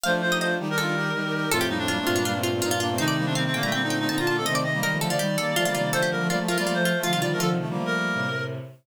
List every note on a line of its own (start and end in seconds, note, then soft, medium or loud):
0.03 0.52 F3 medium
0.03 0.52 A3 medium
0.03 0.21 D4 medium
0.03 0.21 F4 loud
0.03 0.14 C5 medium
0.03 0.12 F5 loud
0.21 0.31 D4 medium
0.21 0.31 F4 medium
0.21 0.37 C5 medium
0.31 0.40 D#4 medium
0.31 0.40 G4 medium
0.31 0.41 D#5 loud
0.40 0.58 D4 medium
0.40 0.58 F4 medium
0.40 0.55 C5 medium
0.40 0.50 D#5 loud
0.59 1.11 D#3 medium
0.59 1.11 G3 medium
0.59 0.68 D#4 medium
0.59 0.68 G4 loud
0.70 0.79 D#4 medium
0.70 0.79 G4 medium
0.70 1.50 A#4 medium
0.78 0.95 D4 medium
0.78 0.95 F4 medium
0.78 1.09 A4 medium
0.96 1.11 D#4 medium
0.96 1.11 G4 medium
1.14 1.45 D#3 medium
1.14 1.45 G3 medium
1.14 1.23 D#4 medium
1.14 1.23 G4 medium
1.25 1.33 D#4 medium
1.25 1.33 G4 medium
1.34 1.49 D#4 medium
1.34 1.49 G4 medium
1.51 1.96 F2 medium
1.51 1.96 A2 medium
1.51 1.69 A3 medium
1.51 1.69 C4 loud
1.51 1.67 F4 medium
1.51 1.60 A4 loud
1.61 1.70 G4 loud
1.69 1.78 G3 medium
1.69 1.78 A#3 medium
1.69 1.78 D#4 medium
1.78 1.87 A3 medium
1.78 1.87 C4 medium
1.78 2.38 D4 medium
1.88 1.99 G3 medium
1.88 1.99 A#3 medium
1.88 1.97 F4 medium
1.99 2.17 A3 medium
1.99 2.17 C4 medium
2.06 2.60 G2 medium
2.06 2.60 A#2 medium
2.06 2.15 F4 loud
2.16 2.25 G3 medium
2.16 2.25 A#3 medium
2.16 2.24 F4 medium
2.25 2.34 G3 medium
2.25 2.34 A#3 medium
2.25 2.42 F4 medium
2.35 2.51 A3 medium
2.35 2.51 C4 medium
2.43 2.61 F4 loud
2.54 2.62 A3 medium
2.54 2.62 C4 medium
2.62 2.98 G2 medium
2.62 2.98 A#2 medium
2.62 2.71 C4 medium
2.62 2.71 D#4 medium
2.62 2.70 F4 loud
2.71 2.80 D4 medium
2.71 2.80 F4 loud
2.71 2.80 F4 medium
2.80 2.89 A#3 loud
2.80 2.89 D4 loud
2.80 2.96 F4 medium
2.90 2.98 A3 medium
2.90 2.98 C4 loud
2.98 3.50 C3 medium
2.98 3.50 D#3 medium
2.98 3.15 A3 medium
2.98 3.15 C4 loud
2.98 3.25 D#4 loud
2.98 3.07 C5 loud
3.08 3.16 D5 medium
3.17 3.26 G3 medium
3.17 3.26 A#3 loud
3.25 3.35 A3 medium
3.25 3.35 C4 loud
3.25 3.34 D4 medium
3.35 3.45 G3 medium
3.35 3.45 A#3 medium
3.35 3.44 C4 medium
3.35 3.44 F5 loud
3.45 3.61 A3 medium
3.45 3.61 C4 medium
3.45 3.55 C4 medium
3.53 4.07 A#2 medium
3.53 4.07 D3 medium
3.53 3.63 A#3 medium
3.53 3.63 G5 loud
3.62 3.70 G3 medium
3.62 3.73 A3 medium
3.62 3.70 A#3 medium
3.62 3.72 A#5 loud
3.72 3.82 G3 medium
3.72 3.82 A#3 medium
3.72 3.83 C4 medium
3.72 3.88 G5 loud
3.83 3.98 A3 medium
3.83 3.98 C4 medium
3.83 3.99 D#4 medium
3.90 4.06 G5 medium
3.99 4.08 A3 medium
3.99 4.08 C4 medium
3.99 4.09 D#4 medium
4.09 4.41 A#2 medium
4.09 4.41 D3 medium
4.09 4.18 C4 medium
4.09 4.18 D#4 medium
4.09 4.19 D#4 medium
4.09 4.18 A5 loud
4.18 4.29 D4 medium
4.18 4.27 F4 medium
4.18 4.29 F4 medium
4.18 4.27 A#5 loud
4.27 4.38 A#3 medium
4.27 4.38 D4 medium
4.27 4.37 F4 medium
4.27 4.43 A5 medium
4.37 4.47 A3 medium
4.37 4.47 C4 medium
4.37 4.46 A4 medium
4.46 4.80 C3 medium
4.46 4.80 D#3 medium
4.46 4.63 A3 medium
4.46 4.63 C4 loud
4.46 4.55 D#5 loud
4.46 4.55 D#5 medium
4.55 4.64 D5 loud
4.64 4.73 A3 medium
4.64 4.73 C4 medium
4.64 4.80 D#5 medium
4.74 4.82 G3 medium
4.74 4.82 A#3 loud
4.81 4.91 D#3 medium
4.81 4.99 D#3 medium
4.81 4.91 G3 medium
4.81 4.99 G3 medium
4.81 4.92 A#4 loud
4.81 4.98 D#5 medium
4.92 5.00 F3 medium
4.92 5.00 A3 medium
5.00 5.09 D3 medium
5.00 5.09 F3 medium
5.00 5.18 F3 medium
5.00 5.18 A3 medium
5.00 5.10 A4 loud
5.10 5.19 D3 medium
5.10 5.19 F3 medium
5.10 5.19 F4 medium
5.10 5.90 D5 medium
5.19 5.53 D#3 medium
5.19 5.36 D#3 medium
5.19 5.53 G3 medium
5.19 5.36 G3 medium
5.19 5.35 G4 medium
5.38 5.55 G3 medium
5.38 5.55 A#3 medium
5.38 5.55 A4 loud
5.56 5.65 F3 medium
5.56 5.67 F3 medium
5.56 5.65 A3 medium
5.56 5.67 A3 medium
5.56 5.65 F4 loud
5.65 5.74 D3 medium
5.65 5.74 F3 medium
5.65 5.75 G3 medium
5.65 5.75 A#3 medium
5.65 5.74 F4 medium
5.75 5.92 C3 medium
5.75 5.92 D#3 medium
5.75 5.93 G3 medium
5.75 5.93 A#3 medium
5.75 5.89 F4 medium
5.92 6.28 D3 medium
5.92 6.07 F3 medium
5.92 6.28 F3 medium
5.92 6.07 A3 loud
5.92 6.02 A4 loud
5.92 6.10 C5 medium
6.02 6.11 G4 medium
6.11 6.20 G3 medium
6.11 6.20 A#3 medium
6.11 6.27 A#4 medium
6.21 6.29 F3 medium
6.21 6.29 A3 medium
6.29 6.38 F3 medium
6.29 6.39 G3 medium
6.29 6.38 A3 medium
6.29 6.39 A#3 medium
6.29 6.39 F4 loud
6.29 6.38 D5 medium
6.39 6.47 F3 medium
6.39 6.56 F3 medium
6.39 6.47 A3 medium
6.39 6.56 A3 medium
6.48 6.63 F3 medium
6.48 6.63 A3 medium
6.48 6.57 F4 loud
6.48 6.58 A#4 medium
6.58 6.66 G3 medium
6.58 6.66 A#3 loud
6.58 6.66 F4 loud
6.58 6.74 D5 medium
6.66 7.01 F3 medium
6.66 6.76 G3 medium
6.66 7.01 A3 medium
6.66 6.76 A#3 loud
6.66 6.84 F4 medium
6.74 6.92 F3 medium
6.74 6.92 A3 medium
6.74 6.99 C5 medium
6.85 7.02 F4 loud
6.96 7.05 F3 medium
6.96 7.05 A3 loud
7.03 7.14 D3 medium
7.03 7.12 F3 medium
7.03 7.14 F3 medium
7.03 7.12 A3 medium
7.03 7.12 F4 loud
7.03 7.19 F5 medium
7.13 7.23 C3 medium
7.13 7.21 D#3 medium
7.13 7.23 D#3 medium
7.13 7.21 G3 medium
7.13 7.21 F4 loud
7.21 7.39 D3 medium
7.21 7.32 D#3 medium
7.21 7.39 F3 medium
7.21 7.32 G3 medium
7.21 7.39 F4 medium
7.21 7.30 D5 loud
7.32 7.41 F3 medium
7.32 7.41 A3 loud
7.32 7.41 A#4 medium
7.40 7.49 D3 medium
7.40 7.58 D3 medium
7.40 7.49 F3 medium
7.40 7.58 F3 medium
7.40 8.19 F4 loud
7.40 7.50 A4 loud
7.49 7.65 C3 medium
7.49 7.65 D#3 medium
7.60 7.69 F3 medium
7.60 7.69 A3 medium
7.68 7.77 D3 medium
7.68 7.77 F3 medium
7.68 8.29 G3 medium
7.68 8.29 A#3 medium
7.77 8.09 F3 medium
7.77 8.09 A3 medium
7.86 8.44 A#4 medium
8.14 8.58 A2 soft
8.14 8.58 C3 medium